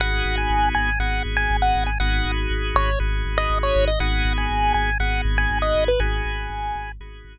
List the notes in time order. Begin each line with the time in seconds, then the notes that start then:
0.00 G#1 B3 D#4 F#4 G#4 F#5
0.25 G#1
0.38 G#5
0.50 G#1
0.75 G#1 G#5
0.99 G#1 B3 D#4 F#4 G#4 F#5
1.25 G#1
1.37 G#5
1.50 G#1
1.62 F#5
1.75 G#1
1.86 G#5
2.00 G#1 B3 D#4 F#4 G#4 F#5
2.25 G#1
2.50 G#1
2.75 G#1 C#5
2.99 G#1 B3 D#4 F#4 G#4
3.25 G#1
3.38 D#5
3.50 G#1
3.63 C#5
3.76 G#1
3.88 D#5
4.00 G#1 B3 D#4 F#4 G#4 F#5
4.25 G#1
4.38 G#5
4.50 G#1
4.74 G#1 G#5
5.00 G#1 B3 D#4 F#4 G#4 F#5
5.25 G#1
5.38 G#5
5.51 G#1
5.62 D#5
5.75 G#1
5.88 B4
5.99 G#1 B3 D#4 F#4 G#4 G#5
6.26 G#1
6.50 G#1
6.76 G#1
7.00 G#1 B3 D#4 F#4 G#4
7.25 G#1